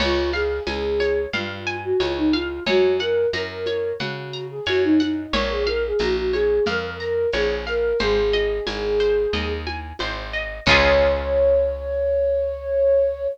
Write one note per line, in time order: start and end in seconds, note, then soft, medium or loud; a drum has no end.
0.00 0.60 C#2 medium
0.00 0.30 F4 loud
0.00 0.30 C#5 medium
0.00 crash loud
0.00 low conga medium
0.00 shaker medium
0.33 0.63 G#4 medium
0.33 0.63 F5 medium
0.33 high conga medium
0.33 shaker medium
0.67 1.27 C#2 medium
0.67 1.21 G#4 medium
0.67 0.97 G#5 medium
0.67 tambourine medium
0.67 high conga medium
0.67 shaker medium
1.00 1.30 C#5 medium
1.00 high conga medium
1.00 shaker medium
1.33 1.93 G2 medium
1.33 1.75 F4 medium
1.33 1.63 F5 medium
1.33 low conga medium
1.33 shaker medium
1.67 1.97 G#5 medium
1.67 shaker medium
1.83 1.99 F#4 medium
2.00 2.60 C#2 medium
2.00 2.17 F4 medium
2.00 2.30 C#5 medium
2.00 tambourine medium
2.00 high conga medium
2.00 shaker medium
2.17 2.32 D#4 medium
2.31 2.62 F4 medium
2.31 2.63 F5 medium
2.31 high conga medium
2.31 shaker medium
2.66 3.26 F#2 medium
2.66 2.97 F#4 medium
2.66 2.97 C#5 medium
2.66 low conga medium
2.66 shaker medium
2.99 3.27 A#4 medium
2.99 3.30 F#5 medium
2.99 high conga medium
2.99 shaker medium
3.33 3.93 F#2 medium
3.33 3.90 A#4 medium
3.33 3.63 A#5 medium
3.33 tambourine medium
3.33 high conga medium
3.33 shaker medium
3.66 3.97 C#5 medium
3.66 high conga medium
3.66 shaker medium
3.99 4.60 C#3 medium
3.99 4.43 F#4 medium
3.99 4.30 F#5 medium
3.99 low conga medium
3.99 shaker medium
4.33 4.63 A#5 medium
4.33 shaker medium
4.50 4.66 G#4 medium
4.66 5.27 F#2 medium
4.66 4.82 F#4 medium
4.66 4.97 C#5 medium
4.66 tambourine medium
4.66 high conga medium
4.66 shaker medium
4.83 4.99 D#4 medium
5.00 5.32 D#4 medium
5.00 5.30 F#5 medium
5.00 high conga medium
5.00 shaker medium
5.33 5.93 A#1 medium
5.33 5.50 A#4 loud
5.33 5.63 C#5 medium
5.33 low conga medium
5.33 shaker medium
5.50 5.66 G#4 medium
5.66 5.82 A#4 medium
5.66 5.97 F5 medium
5.66 high conga medium
5.66 shaker medium
5.85 6.01 G#4 medium
5.99 6.60 A#1 medium
5.99 6.15 F#4 medium
5.99 6.30 A#5 medium
5.99 tambourine medium
5.99 high conga medium
5.99 shaker medium
6.15 6.31 F#4 medium
6.32 6.63 G#4 medium
6.32 6.63 C#5 medium
6.32 high conga medium
6.32 shaker medium
6.66 7.27 F2 medium
6.66 6.83 A#4 medium
6.66 6.97 F5 medium
6.66 low conga medium
6.66 shaker medium
6.83 6.99 A#4 medium
7.00 7.27 A#4 medium
7.00 7.30 A#5 medium
7.00 shaker medium
7.33 7.93 A#1 medium
7.33 7.65 G#4 medium
7.33 7.63 C#5 medium
7.33 tambourine medium
7.33 high conga medium
7.33 shaker medium
7.67 7.97 A#4 medium
7.67 7.97 F5 medium
7.67 shaker medium
7.99 8.60 G#1 medium
7.99 9.51 G#4 medium
7.99 8.30 C5 medium
7.99 low conga medium
7.99 shaker medium
8.33 8.63 D#5 medium
8.33 high conga medium
8.33 shaker medium
8.67 9.27 G#1 medium
8.67 8.97 G#5 medium
8.67 tambourine medium
8.67 high conga medium
8.67 shaker medium
8.99 9.30 C5 medium
8.99 shaker medium
9.33 9.93 D#2 medium
9.33 9.63 D#5 medium
9.33 low conga medium
9.33 shaker medium
9.67 9.97 G#5 medium
9.67 high conga medium
9.67 shaker medium
9.99 10.60 G#1 medium
9.99 10.30 C5 medium
9.99 tambourine medium
9.99 high conga medium
9.99 shaker medium
10.33 10.63 D#5 medium
10.33 shaker medium
10.65 13.27 C#2 loud
10.65 13.27 C#4 loud
10.65 13.27 F4 medium
10.65 13.26 C#5 loud
10.65 kick loud
10.65 crash loud
10.71 13.27 G#4 loud